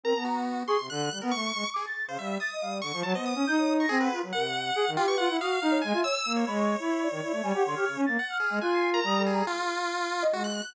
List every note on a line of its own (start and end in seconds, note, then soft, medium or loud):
0.03 0.13 C4 medium
0.03 0.14 A#4 medium
0.03 0.24 A#5 medium
0.15 0.63 B3 medium
0.15 0.25 A5 medium
0.24 0.63 F#4 soft
0.24 0.35 A#5 medium
0.67 0.77 G#4 loud
0.67 0.87 C6 medium
0.67 0.78 C#6 loud
0.79 0.89 C3 medium
0.90 1.09 D3 loud
0.90 1.19 F#6 medium
1.11 1.20 G3 soft
1.22 1.32 B3 loud
1.22 1.31 A#4 medium
1.31 1.52 A3 medium
1.31 1.70 C#6 loud
1.54 1.64 G#3 medium
1.74 1.86 G#4 medium
1.74 1.83 D6 loud
1.86 2.05 A6 loud
2.07 2.17 C#3 medium
2.07 2.18 C5 medium
2.07 2.18 F5 medium
2.18 2.37 G3 medium
2.18 2.38 E5 medium
2.18 2.29 F5 medium
2.40 2.78 D#6 medium
2.40 2.50 A6 loud
2.51 2.61 D#5 medium
2.61 2.81 G3 soft
2.61 2.71 F5 loud
2.71 2.80 D5 medium
2.81 2.92 D3 medium
2.81 3.01 C#6 medium
2.93 3.03 F3 loud
3.03 3.14 F#3 loud
3.03 3.13 A5 medium
3.14 3.34 B3 medium
3.14 3.33 C5 medium
3.14 3.25 D#5 medium
3.25 3.74 D#6 medium
3.35 3.45 C#4 loud
3.47 3.86 D#4 medium
3.47 3.57 G6 loud
3.58 3.77 C#5 loud
3.80 3.89 C#6 medium
3.80 4.00 A#6 loud
3.89 4.09 C4 loud
3.89 3.98 G#4 loud
4.00 4.19 B4 medium
4.00 4.10 F#5 medium
4.12 4.21 F4 medium
4.22 4.32 F#3 medium
4.32 4.71 C3 medium
4.32 4.44 A#4 medium
4.32 4.90 F#5 loud
4.44 4.54 F#5 medium
4.76 4.85 G#4 loud
4.86 4.96 D#3 medium
4.97 5.06 F4 loud
4.97 5.16 G4 medium
4.97 5.06 G5 medium
5.07 5.26 B4 loud
5.07 5.17 C#6 loud
5.18 5.28 F4 loud
5.18 5.37 F#5 loud
5.29 5.39 E4 medium
5.39 5.59 F#4 medium
5.39 5.79 F5 loud
5.39 5.49 D#6 medium
5.62 5.81 D#4 loud
5.71 5.81 C#5 loud
5.81 5.93 G#3 loud
5.81 6.01 G#5 medium
5.93 6.03 F4 loud
5.93 6.04 E5 medium
6.04 6.14 C#5 loud
6.04 6.33 E6 loud
6.25 6.44 A#3 medium
6.36 6.46 C#5 medium
6.47 6.76 G#3 medium
6.47 8.01 C#5 medium
6.47 6.57 B5 medium
6.58 6.77 C#6 medium
6.79 7.08 E4 medium
6.79 7.00 B5 medium
7.01 7.40 D5 medium
7.11 7.21 D#3 medium
7.22 7.32 E4 medium
7.32 7.42 A3 medium
7.43 7.52 G3 loud
7.43 7.53 G#5 loud
7.54 7.64 G4 loud
7.54 7.64 F#5 medium
7.65 7.75 D3 loud
7.65 7.75 C6 medium
7.75 7.85 G4 medium
7.75 7.94 F6 medium
7.87 7.96 C#3 medium
7.96 8.06 C#4 loud
8.06 8.17 A#3 medium
8.06 8.25 A6 medium
8.19 8.38 F#5 medium
8.30 8.49 F6 medium
8.40 8.59 G#4 medium
8.50 8.60 G#3 medium
8.50 8.59 F6 medium
8.61 9.00 F4 loud
8.61 8.90 G#5 medium
8.61 8.71 F#6 medium
8.72 8.92 C7 medium
8.92 9.02 A#4 medium
8.92 9.23 A#5 loud
9.04 9.42 G3 loud
9.04 9.18 D#6 medium
9.18 9.31 A4 medium
9.26 9.46 G#4 medium
9.31 9.44 A#5 medium
9.47 10.24 F4 loud
10.22 10.32 D#5 loud
10.32 10.61 G#3 medium
10.32 10.43 F#4 medium
10.44 10.73 F#6 medium
10.64 10.74 F#6 medium